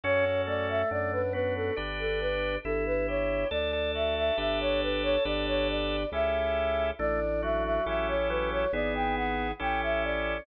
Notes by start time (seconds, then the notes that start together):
0.04 F#2 C#4 F#4 A4 C#5
0.47 A3 D5
0.69 E5
0.91 F#2 D4 D5
1.12 B4
1.33 B3 F#4 B4
1.55 A4
1.76 G1 D4 G4 B4
1.99 A4
2.20 B4
2.64 G1 E4 A4
2.86 B4
3.08 G4 C#5
3.51 D2 D4 A4 D5
3.73 A4
3.94 F#4 E5
4.16 E5
4.37 G1 D4 G4 B4 E5
4.60 C#5
4.82 B4
5.03 C#5
5.25 G1 D4 G4 B4 D5
5.47 C#5
5.69 D5
6.12 C#2 C#4 E4 G4 A4 E5
6.99 A1 A3 D4 D5
7.42 F#3 F#4 E5
7.64 E5
7.86 A1 C#4 E4 G4 A4 E5
8.08 C#5
8.29 F#3 B4
8.51 C#5
8.73 G#1 B3 E4 G#4 D5
8.95 G5
9.16 F#5
9.59 A1 C#4 E4 G4 A4 G5
9.82 E5
10.03 D5